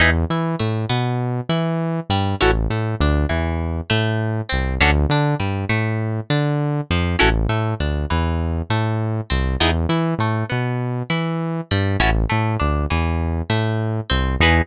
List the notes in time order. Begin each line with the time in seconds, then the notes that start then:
0.00 E2 D#4 E4 G#4 B4
0.30 E3 E4
0.59 A2 A3
0.90 B2 B3
1.49 E3 E4
2.10 G2 G3
2.41 A1 C#4 E4 F#4 A4
2.70 A2 A3
3.00 D2 D4
3.29 E2 E3
3.90 A2 A3
4.49 C2 C4
4.80 D2 C#4 D4 F#4 A4
5.09 D3 D4
5.40 G2 G3
5.69 A2 A3
6.30 D3 D4
6.91 F2 F3
7.19 A1 C#4 E4 F#4 A4
7.49 A2 A3
7.80 D2 D4
8.10 E2 E3
8.70 A2 A3
9.30 C2 C4
9.60 E2 B3 D#4 E4 G#4
9.89 E3 E4
10.19 A2 A3
10.50 B2 B3
11.10 E3 E4
11.71 G2 G3
12.00 A1 C#4 E4 F#4 A4
12.29 A2 A3
12.60 D2 D4
12.90 E2 E3
13.50 A2 A3
14.10 C2 C4
14.40 E2 D#4 E4 G#4 B4